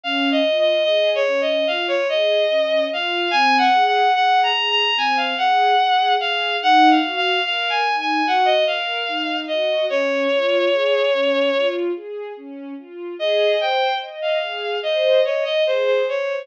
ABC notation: X:1
M:4/4
L:1/16
Q:1/4=73
K:Db
V:1 name="Violin"
(3f2 e2 e2 (3e2 d2 e2 f d e4 f2 | (3a2 g2 g2 (3g2 b2 b2 a f g4 f2 | (3g2 f2 f2 (3f2 a2 a2 g e f4 e2 | d10 z6 |
[K:Ab] e2 g2 z f3 e2 d e c c d2 |]
V:2 name="String Ensemble 1"
D2 F2 A2 D2 F2 A2 D2 F2 | C2 A2 A2 A2 C2 A2 A2 A2 | E2 G2 B2 E2 G2 B2 E2 G2 | D2 F2 A2 D2 F2 A2 D2 F2 |
[K:Ab] A2 c2 e2 A2 c2 e2 A2 c2 |]